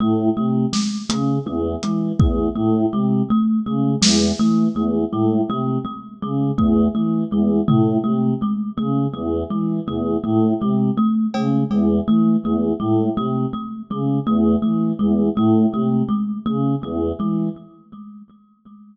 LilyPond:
<<
  \new Staff \with { instrumentName = "Choir Aahs" } { \clef bass \time 2/4 \tempo 4 = 82 a,8 c8 r8 cis8 | e,8 e8 e,8 a,8 | c8 r8 cis8 e,8 | e8 e,8 a,8 c8 |
r8 cis8 e,8 e8 | e,8 a,8 c8 r8 | cis8 e,8 e8 e,8 | a,8 c8 r8 cis8 |
e,8 e8 e,8 a,8 | c8 r8 cis8 e,8 | e8 e,8 a,8 c8 | r8 cis8 e,8 e8 | }
  \new Staff \with { instrumentName = "Kalimba" } { \time 2/4 a8 a8 gis8 a8 | a8 gis8 a8 a8 | gis8 a8 a8 gis8 | a8 a8 gis8 a8 |
a8 gis8 a8 a8 | gis8 a8 a8 gis8 | a8 a8 gis8 a8 | a8 gis8 a8 a8 |
gis8 a8 a8 gis8 | a8 a8 gis8 a8 | a8 gis8 a8 a8 | gis8 a8 a8 gis8 | }
  \new DrumStaff \with { instrumentName = "Drums" } \drummode { \time 2/4 r4 sn8 hh8 | tommh8 hh8 bd4 | r4 r8 sn8 | r4 r4 |
r4 bd4 | r8 tomfh8 r4 | r4 r8 tomfh8 | r4 r8 cb8 |
cb4 r4 | r4 r4 | r4 r4 | r4 r4 | }
>>